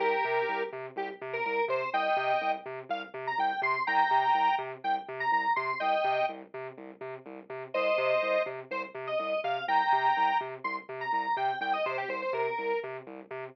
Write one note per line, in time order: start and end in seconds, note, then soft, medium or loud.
0.00 0.13 C2 loud
0.00 0.63 G4 medium
0.00 0.63 A#4 medium
0.25 0.38 C3 medium
0.49 0.62 C2 medium
0.73 0.86 C3 medium
0.96 1.09 C2 loud
0.96 1.09 G4 medium
1.21 1.35 C3 loud
1.33 1.45 A#4 medium
1.45 1.59 C2 medium
1.45 1.65 A#4 medium
1.68 1.81 C3 medium
1.68 1.90 C5 medium
1.93 2.07 C2 loud
1.93 2.52 D#5 medium
1.93 2.52 G5 medium
2.17 2.30 C3 loud
2.41 2.55 C2 medium
2.66 2.79 C3 medium
2.89 3.03 C2 loud
2.89 3.02 F5 medium
3.14 3.27 C3 loud
3.27 3.39 A#5 medium
3.38 3.51 C2 medium
3.38 3.61 G5 medium
3.62 3.75 C3 medium
3.62 3.83 C6 medium
3.87 4.01 C2 loud
3.87 4.55 G5 medium
3.87 4.55 A#5 medium
4.11 4.24 C3 medium
4.34 4.48 C2 medium
4.58 4.72 C3 loud
4.84 4.97 C2 medium
4.84 4.95 G5 medium
5.08 5.22 C3 loud
5.20 5.31 A#5 medium
5.32 5.45 C2 medium
5.32 5.53 A#5 medium
5.56 5.70 C3 medium
5.56 5.78 C6 medium
5.80 5.94 C2 medium
5.80 6.26 D#5 medium
5.80 6.26 G5 medium
6.04 6.18 C3 medium
6.29 6.42 C2 medium
6.54 6.67 C3 medium
6.78 6.91 C2 medium
7.01 7.14 C3 medium
7.26 7.39 C2 loud
7.50 7.63 C3 medium
7.74 7.88 C2 loud
7.74 8.42 C5 medium
7.74 8.42 D#5 medium
7.98 8.11 C3 loud
8.23 8.36 C2 medium
8.46 8.59 C3 medium
8.71 8.84 C2 medium
8.71 8.83 C5 medium
8.95 9.08 C3 loud
9.07 9.18 D#5 medium
9.19 9.33 C2 medium
9.19 9.40 D#5 medium
9.44 9.57 C3 medium
9.44 9.65 F5 medium
9.68 9.81 C2 medium
9.68 10.38 G5 medium
9.68 10.38 A#5 medium
9.93 10.06 C3 medium
10.17 10.30 C2 medium
10.41 10.54 C3 medium
10.64 10.78 C2 medium
10.64 10.76 C6 medium
10.89 11.02 C3 medium
11.01 11.12 A#5 medium
11.13 11.26 C2 medium
11.13 11.36 A#5 medium
11.37 11.50 C3 medium
11.37 11.59 G5 medium
11.61 11.74 C2 loud
11.61 11.73 G5 medium
11.73 11.85 D#5 medium
11.86 11.99 C3 loud
11.86 11.97 C5 medium
11.98 12.09 G4 medium
12.08 12.22 C2 medium
12.08 12.21 C5 medium
12.22 12.33 C5 medium
12.33 12.46 C3 medium
12.33 12.80 A#4 medium
12.58 12.72 C2 medium
12.83 12.97 C3 loud
13.07 13.20 C2 loud
13.31 13.44 C3 loud